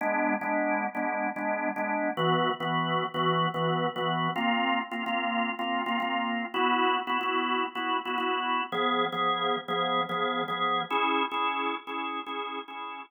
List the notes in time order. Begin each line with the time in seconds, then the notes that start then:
0.01 G#3 B3 D4
0.41 G#3 B3 D4
0.95 G#3 B3 D4
1.36 G#3 B3 D4
1.76 G#3 B3 D4
2.17 E3 B3 F#4
2.60 E3 B3 F#4
3.14 E3 B3 F#4
3.54 E3 B3 F#4
3.96 E3 B3 F#4
4.36 A#3 C4 F4
4.91 A#3 C4 F4
5.06 A#3 C4 F4
5.59 A#3 C4 F4
5.86 A#3 C4 F4
6.00 A#3 C4 F4
6.54 B3 E4 F#4
7.07 B3 E4 F#4
7.21 B3 E4 F#4
7.75 B3 E4 F#4
8.05 B3 E4 F#4
8.18 B3 E4 F#4
8.72 F3 B3 G#4
9.12 F3 B3 G#4
9.68 F3 B3 G#4
10.09 F3 B3 G#4
10.48 F3 B3 G#4
10.90 C#4 E4 G#4
11.31 C#4 E4 G#4
11.87 C#4 E4 G#4
12.26 C#4 E4 G#4
12.68 C#4 E4 G#4